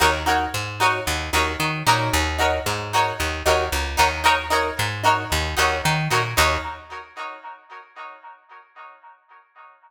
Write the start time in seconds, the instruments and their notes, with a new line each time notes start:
0.00 electric bass (finger) D#2, pizzicato strings D#4 F#4 A#4 C#5
0.26 pizzicato strings D#4 F#4 A#4 C#5
0.54 electric bass (finger) G#2
0.80 pizzicato strings D#4 F#4 A#4 C#5
1.07 electric bass (finger) D#2
1.33 electric bass (finger) D#2, pizzicato strings D#4 F#4 A#4 C#5
1.60 electric bass (finger) D#3
1.87 electric bass (finger) A#2, pizzicato strings D#4 F#4 A#4 C#5
2.13 electric bass (finger) D#2
2.38 pizzicato strings D#4 F#4 A#4 C#5
2.66 electric bass (finger) G#2
2.93 pizzicato strings D#4 F#4 A#4 C#5
3.20 electric bass (finger) D#2
3.46 electric bass (finger) D#2, pizzicato strings D#4 F#4 A#4 C#5
3.72 electric bass (finger) C#2
3.97 electric bass (finger) D#2, pizzicato strings D#4 F#4 A#4 C#5
4.24 pizzicato strings D#4 F#4 A#4 C#5
4.50 pizzicato strings D#4 F#4 A#4 C#5
4.79 electric bass (finger) G#2
5.04 pizzicato strings D#4 F#4 A#4 C#5
5.32 electric bass (finger) D#2
5.57 electric bass (finger) D#2, pizzicato strings D#4 F#4 A#4 C#5
5.85 electric bass (finger) D#3
6.11 electric bass (finger) A#2, pizzicato strings D#4 F#4 A#4 C#5
6.37 electric bass (finger) D#2, pizzicato strings D#4 F#4 A#4 C#5